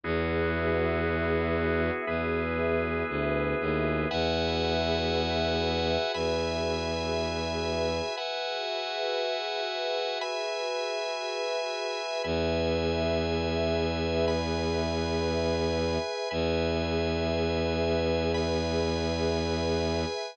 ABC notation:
X:1
M:4/4
L:1/8
Q:1/4=59
K:E
V:1 name="Drawbar Organ"
[B,EFG]4 [B,EGB]4 | [Befg]4 [Begb]4 | [Befg]4 [Begb]4 | [Beg]4 [Bgb]4 |
[Beg]4 [Bgb]4 |]
V:2 name="Pad 2 (warm)"
[FGBe]8 | [FGBe]8 | [FGBe]8 | [GBe]8 |
[GBe]8 |]
V:3 name="Violin" clef=bass
E,,4 E,,2 =D,, ^D,, | E,,4 E,,4 | z8 | E,,8 |
E,,8 |]